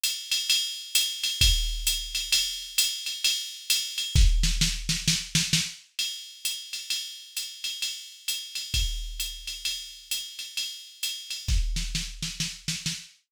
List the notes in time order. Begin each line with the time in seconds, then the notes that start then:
0.03 hi-hat pedal, ride
0.31 ride
0.50 ride
0.95 hi-hat pedal, ride
1.23 ride
1.41 kick, ride
1.87 hi-hat pedal, ride
2.15 ride
2.32 ride
2.78 hi-hat pedal, ride
3.06 ride
3.24 ride
3.70 hi-hat pedal, ride
3.98 ride
4.15 kick, snare
4.43 snare
4.61 snare
4.89 snare
5.08 snare
5.35 snare
5.53 snare
5.99 ride
6.45 hi-hat pedal, ride
6.73 ride
6.90 ride
7.37 hi-hat pedal, ride
7.64 ride
7.82 ride
8.28 hi-hat pedal, ride
8.55 ride
8.74 kick, ride
9.20 hi-hat pedal, ride
9.47 ride
9.65 ride
10.11 hi-hat pedal, ride
10.39 ride
10.57 ride
11.03 hi-hat pedal, ride
11.30 ride
11.48 kick, snare
11.76 snare
11.95 snare
12.22 snare
12.40 snare
12.68 snare
12.86 snare